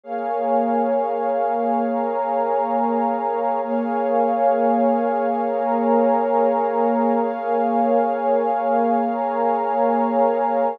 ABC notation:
X:1
M:6/8
L:1/8
Q:3/8=67
K:Bbdor
V:1 name="Pad 2 (warm)"
[Bdfa]6 | [Bdab]6 | [Bdfa]6 | [Bdab]6 |
[Bdfa]6 | [Bdab]6 |]
V:2 name="Pad 2 (warm)"
[B,Adf]6- | [B,Adf]6 | [B,Adf]6- | [B,Adf]6 |
[B,Adf]6- | [B,Adf]6 |]